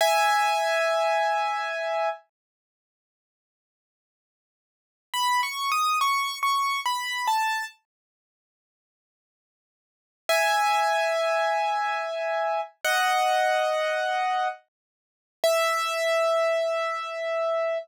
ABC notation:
X:1
M:3/4
L:1/8
Q:1/4=70
K:E
V:1 name="Acoustic Grand Piano"
[eg]6 | z6 | (3b c' d' c' c' b a | z6 |
[eg]6 | [df]4 z2 | e6 |]